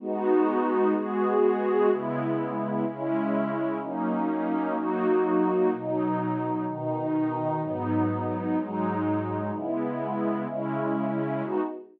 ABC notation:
X:1
M:4/4
L:1/8
Q:1/4=126
K:G#m
V:1 name="Pad 2 (warm)"
[G,B,DF]4 [G,B,FG]4 | [C,G,B,E]4 [C,G,CE]4 | [F,A,CD]4 [F,A,DF]4 | [B,,F,D]4 [B,,D,D]4 |
[G,,F,B,D]4 [G,,F,G,D]4 | [C,G,B,E]4 [C,G,CE]4 | [G,B,DF]2 z6 |]